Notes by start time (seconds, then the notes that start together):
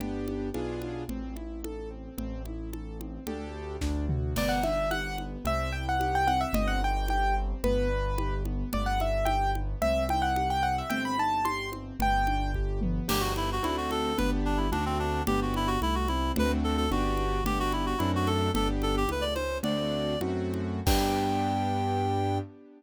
0.00 G1 B3 D4 G4, low conga
0.28 high conga
0.54 B1 B3 D4 F4 G#4, high conga
0.82 high conga
1.09 A1 C4, low conga
1.36 E4, high conga
1.64 A4, high conga
1.90 C4
2.18 A1 C4, low conga
2.46 E4, high conga
2.73 A4, high conga
3.00 C4, high conga
3.27 D2 D4 G4 A4, low conga
3.81 D2 D4, kick, snare
4.09 F#4, mid tom
4.36 G1 B3 D5, crash, low conga
4.49 F#5
4.63 D4 E5, high conga
4.91 G4 F#5, high conga
5.18 B3, high conga
5.45 C2 C4 E5, low conga
5.72 E4 G5
5.89 F#5
6.00 G4, high conga
6.15 G5
6.27 C4 F#5, high conga
6.41 E5
6.53 G1 C4 D#5, low conga
6.68 F#5
6.81 D#4 G5
7.08 G4 G5, high conga
7.37 C4
7.63 G1 B3 B4, low conga
7.90 D4
8.18 G4, high conga
8.45 B3, high conga
8.73 G1 B3 D5, low conga
8.86 F#5
9.00 D4 E5, high conga
9.25 G4 G5, high conga
9.55 B3, high conga
9.81 C2 C4 E5, low conga
10.09 E4 G5, high conga
10.22 F#5
10.36 G4, high conga
10.50 G5
10.63 C4 F#5
10.78 E5
10.90 G1 C4 G5, low conga
11.05 B5
11.18 D#4 A5
11.45 G4 C6, high conga
11.72 C4, high conga
12.00 G1 B3 G5, low conga
12.27 D4, high conga
12.54 G4, kick
12.81 B3, high tom
13.08 G1 B3 D4 G4, crash, low conga
13.20 F#4
13.36 E4, high conga
13.52 F#4
13.63 D2 A3 C4 D4 E4 F#4, high conga
13.77 F#4
13.91 A4, high conga
14.18 G1 B3 D4 G4 B4, low conga
14.45 D4
14.57 E4
14.72 D2 A3 C4 D4 F#4, high conga
14.86 C4
14.99 D4
15.27 G1 B3 D4 G4, low conga
15.42 F#4
15.54 E4, high conga
15.67 F#4
15.82 C2 A3 E4, high conga
15.95 F#4
16.08 C4 E4, high conga
16.36 D2 A3 C4 D4 F#4 B4, low conga
16.64 A4
16.77 A4
16.91 G1 B3 D4 F#4 G4, high conga
17.17 high conga
17.44 G1 B3 D4 G4, low conga
17.60 F#4
17.72 E4, high conga
17.86 F#4
17.98 F#2 A3 C4 D4 E4 F#4, high conga
18.15 F#4
18.27 A4, high conga
18.54 G1 B3 D4 G4 A4, low conga
18.82 A4, high conga
18.97 G4
19.08 C#2 A3 B4, high conga
19.21 D5
19.35 C#4 C5, high conga
19.63 D2 A3 C4 D4 F#4 D5, low conga
20.21 F#2 A3 C4 F#4, high conga
20.54 high conga
20.86 G2 B3 D4 G4 G5, kick, crash